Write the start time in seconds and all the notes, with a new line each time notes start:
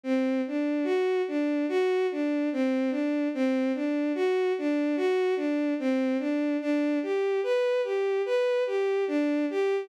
0.04 C4
0.47 D4
0.84 F#4
1.28 D4
1.69 F#4
2.12 D4
2.53 C4
2.91 D4
3.34 C4
3.75 D4
4.15 F#4
4.58 D4
4.97 F#4
5.36 D4
5.79 C4
6.19 D4
6.61 D4
7.03 G4
7.43 B4
7.84 G4
8.26 B4
8.67 G4
9.08 D4
9.50 G4